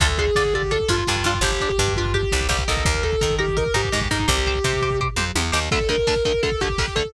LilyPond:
<<
  \new Staff \with { instrumentName = "Distortion Guitar" } { \time 4/4 \key d \phrygian \tempo 4 = 168 a'8 aes'4 g'8 a'8 f'4 f'8 | g'8. g'8. f'8 g'4 g'8 a'8 | bes'8 a'4 g'8 bes'8 g'4 ees'8 | g'2 r2 |
a'8 bes'4 bes'8 a'8 g'4 a'8 | }
  \new Staff \with { instrumentName = "Overdriven Guitar" } { \time 4/4 \key d \phrygian <d' f' a'>8 <d' f' a'>8 <d' f' a'>8 <d' f' a'>8 <d' f' a'>8 <d' f' a'>8 <d' f' a'>8 <d' f' a'>8 | <d' g'>8 <d' g'>8 <d' g'>8 <d' g'>8 <d' g'>8 <d' g'>8 <d' g'>8 <ees' bes'>8~ | <ees' bes'>8 <ees' bes'>8 <ees' bes'>8 <ees' bes'>8 <ees' bes'>8 <ees' bes'>8 <ees' bes'>8 <ees' bes'>8 | <g' c''>8 <g' c''>8 <g' c''>8 <g' c''>8 <g' c''>8 <g' c''>8 <g' c''>8 <g' c''>8 |
<d, d a>8 <d, d a>8 <d, d a>8 <d, d a>8 <d, d a>8 <d, d a>8 <d, d a>8 <d, d a>8 | }
  \new Staff \with { instrumentName = "Electric Bass (finger)" } { \clef bass \time 4/4 \key d \phrygian d,4 d4. g,8 g,8 g,8 | g,,4 g,4. c,8 c,8 c,8 | ees,4 ees4. aes,8 aes,8 aes,8 | c,4 c4. f,8 e,8 ees,8 |
r1 | }
  \new DrumStaff \with { instrumentName = "Drums" } \drummode { \time 4/4 <hh bd>16 bd16 <hh bd>16 bd16 <bd sn>16 bd16 <hh bd>16 bd16 <hh bd>16 bd16 <hh bd>16 bd16 <bd sn>16 bd16 <hh bd>16 bd16 | <hh bd>16 bd16 <hh bd>16 bd16 <bd sn>16 bd16 <hh bd>16 bd16 <hh bd>16 bd16 <hh bd>16 bd16 <bd sn>16 bd16 <hh bd>16 bd16 | <hh bd>16 bd16 <hh bd>16 bd16 <bd sn>16 bd16 <hh bd>16 bd16 <hh bd>16 bd16 <hh bd>16 bd16 <bd sn>16 bd16 <hh bd>16 bd16 | <hh bd>16 bd16 <hh bd>16 bd16 <bd sn>16 bd16 <hh bd>16 bd16 <bd tomfh>8 toml8 tommh8 sn8 |
<cymc bd>16 bd16 <hh bd>16 bd16 <bd sn>16 bd16 <hh bd>16 bd16 <hh bd>16 bd16 <hh bd>16 bd16 <bd sn>16 bd16 <hh bd>16 bd16 | }
>>